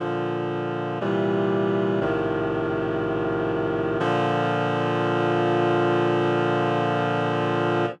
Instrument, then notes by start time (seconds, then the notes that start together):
clarinet
0.00 A#2 D3 F3
1.01 A#2 C3 E3 G3
2.01 A#1 A2 C3 D#3 F3
4.00 A#2 D3 F3